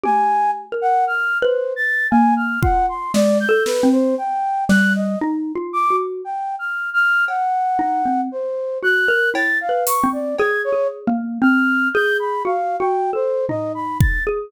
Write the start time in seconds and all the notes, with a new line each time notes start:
0.03 G4 G#5, high tom
0.72 A#4
0.81 F#5
1.07 F6
1.42 B4 C5
1.76 A6
2.11 A#3 G#5
2.36 F6
2.62 F4 F#5, kick
2.88 C6
3.14 G#3 D5, snare
3.40 G6
3.49 A4
3.66 B4, snare
3.83 C4
3.92 C5
4.18 G5
4.69 G3 F#6, snare
4.95 D#5
5.21 D#4
5.55 F4
5.73 D6
5.90 F#4
6.24 G5
6.59 F6
6.94 F6
7.28 F#5, cowbell
7.79 D#4
8.05 C4
8.32 C5
8.83 F#4 F#6
9.08 A#4
9.34 E4 A6, cowbell
9.61 F5
9.69 B4
9.87 C#6, closed hi-hat
10.03 C4
10.13 D5
10.38 G#4 G#6, cowbell
10.64 C#5
10.72 G#4
11.07 A#3
11.42 C4 F6
11.94 G#4 G6
12.19 B5
12.45 F#4 F5
12.80 F#4 G5
13.13 A4 C5
13.49 D#4 D#5, floor tom
13.74 B5
14.00 A6, kick
14.27 G#4